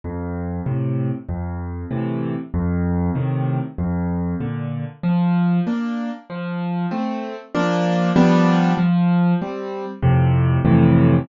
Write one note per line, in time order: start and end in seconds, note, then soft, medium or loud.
0.04 0.61 F2 medium
0.66 1.10 A2 medium
0.66 1.10 C3 medium
1.29 1.85 F2 medium
1.91 2.34 A2 medium
1.91 2.34 C3 medium
1.91 2.34 E3 medium
2.54 3.10 F2 medium
3.15 3.59 A2 medium
3.15 3.59 C3 medium
3.15 3.59 D#3 medium
3.78 4.35 F2 medium
4.40 4.84 A#2 medium
4.40 4.84 D3 medium
5.03 5.60 F3 medium
5.67 6.10 A#3 medium
5.67 6.10 D4 medium
6.30 6.86 F3 medium
6.91 7.35 A3 medium
6.91 7.35 C4 medium
7.55 8.11 F3 medium
7.55 8.11 A#3 medium
7.55 8.11 D4 medium
8.16 8.72 F3 medium
8.16 8.72 G3 medium
8.16 8.72 B3 medium
8.16 8.72 D4 medium
8.78 9.34 F3 medium
9.41 9.85 G3 medium
9.41 9.85 C4 medium
10.03 10.59 F2 medium
10.03 10.59 A2 medium
10.03 10.59 C3 medium
10.65 11.21 F2 medium
10.65 11.21 A2 medium
10.65 11.21 C3 medium
10.65 11.21 E3 medium